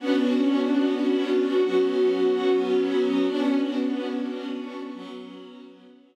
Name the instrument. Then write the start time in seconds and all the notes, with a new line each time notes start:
string ensemble 1
0.00 B3 C#4 D4 F#4
1.64 F#3 B3 C#4 F#4
3.29 B3 C#4 D4 F#4
4.93 F#3 B3 C#4 F#4